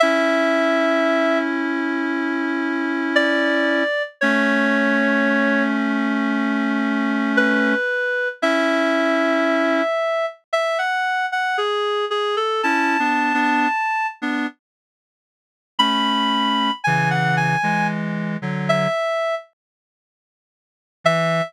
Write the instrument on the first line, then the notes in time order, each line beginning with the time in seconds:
clarinet
0.00 C#4 E4 E5
3.16 D5
4.21 A3 C#4 C#5
7.37 B4
8.42 C#4 E4 E5
10.53 E5
10.79 F#5
11.32 F#5
11.58 G#4
12.11 G#4
12.37 A4
12.63 C#4 E4 A5
12.99 B3 D4
13.34 B3 D4
14.22 B3 D4
15.79 A3 C#4 B5
16.84 C#3 E3 G#5
17.10 F#5
17.37 G#5
17.63 E3 G#3
18.42 D3 F#3
18.69 E5
21.04 E3 E5